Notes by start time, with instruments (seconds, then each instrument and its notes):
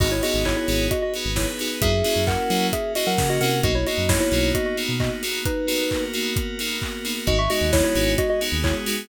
0.00 synth bass 1 G#1, electric piano 2 B3 D#4 F#4 G#4 D#5, pad 5 (bowed) B3 D#4 F#4 G#4, kick, crash
0.11 electric piano 2 E4 C#5
0.23 electric piano 2 B3 D#4 F#4 G#4 D#5, open hi-hat
0.34 synth bass 1 G#1
0.45 electric piano 2 E4 C#5, kick, clap
0.57 electric piano 2 E4 C#5
0.68 synth bass 1 G#1, electric piano 2 B3 D#4 F#4 G#4, open hi-hat
0.91 pad 5 (bowed) B3 D#4 G#4 B4, electric piano 2 F#4 D#5, kick, closed hi-hat
1.02 electric piano 2 F#4 D#5
1.14 electric piano 2 B3 D#4 F#4 G#4, open hi-hat
1.25 synth bass 1 G#1
1.36 electric piano 2 E4 C#5, kick, snare
1.59 electric piano 2 B3 D#4 F#4 G#4, open hi-hat
1.82 synth bass 1 F#2, pad 5 (bowed) A#3 C#4 E4 F#4, electric piano 2 A#3 C#4 E4 F#4 G#4 E5, kick, closed hi-hat
2.04 electric piano 2 A#3 C#4 E4 F#4, open hi-hat
2.16 synth bass 1 F#2
2.27 electric piano 2 A#4 F#5, kick, clap
2.50 synth bass 1 F#3, electric piano 2 A#3 C#4 E4 F#4, open hi-hat
2.73 pad 5 (bowed) A#3 C#4 F#4 A#4, electric piano 2 G#4 E5, kick, closed hi-hat
2.95 electric piano 2 A#3 C#4 E4 F#4 D#5, open hi-hat
3.07 synth bass 1 F#3, electric piano 2 A#4 F#5
3.18 synth bass 1 C#3, kick, snare
3.29 electric piano 2 F#4 D#5
3.41 synth bass 1 C3, electric piano 2 A#3 C#4 E4 F#4 A#4 F#5, open hi-hat
3.63 synth bass 1 B1, electric piano 2 A#3 B3 D#4 F#4 D#5, pad 5 (bowed) A#3 B3 D#4 F#4, kick, closed hi-hat
3.75 electric piano 2 E4 C#5
3.87 electric piano 2 A#3 B3 D#4 F#4 D#5, open hi-hat
3.98 synth bass 1 F#2
4.09 electric piano 2 E4 C#5, kick, snare
4.20 electric piano 2 E4 C#5
4.32 synth bass 1 B1, electric piano 2 A#3 B3 D#4 F#4, open hi-hat
4.55 electric piano 2 F#4 D#5, kick, closed hi-hat
4.66 electric piano 2 F#4 D#5
4.77 electric piano 2 A#3 B3 D#4 F#4, open hi-hat
4.89 synth bass 1 B2
5.00 electric piano 2 F#4 D#5, kick, clap
5.23 electric piano 2 A#3 B3 D#4 F#4, open hi-hat
5.45 pad 5 (bowed) A#3 B3 F#4 A#4, electric piano 2 D#4 B4, kick, closed hi-hat
5.67 electric piano 2 A#3 B3 D#4 F#4, open hi-hat
5.91 kick, clap
6.14 electric piano 2 A#3 B3 D#4 F#4, open hi-hat
6.36 kick, closed hi-hat
6.59 electric piano 2 A#3 B3 D#4 F#4, open hi-hat
6.82 kick, clap
7.05 electric piano 2 A#3 B3 D#4 F#4, open hi-hat
7.26 synth bass 1 G#1, electric piano 2 G#3 B3 D#4 F#4 D#5, pad 5 (bowed) G#3 B3 D#4 F#4, kick, closed hi-hat
7.39 electric piano 2 E5 C#6
7.50 electric piano 2 G#3 B3 D#4 F#4 D#5, open hi-hat
7.61 synth bass 1 D#2
7.73 electric piano 2 E4 C#5, kick, snare
7.84 electric piano 2 E4 C#5
7.95 synth bass 1 G#1, electric piano 2 G#3 B3 D#4 F#4, open hi-hat
8.18 pad 5 (bowed) G#3 B3 F#4 G#4, electric piano 2 F#4 D#5, kick, closed hi-hat
8.30 electric piano 2 F#4 D#5
8.41 electric piano 2 G#3 B3 D#4 F#4, open hi-hat
8.52 synth bass 1 D#2
8.64 electric piano 2 E4 C#5, kick, clap
8.86 electric piano 2 G#3 B3 D#4 F#4, open hi-hat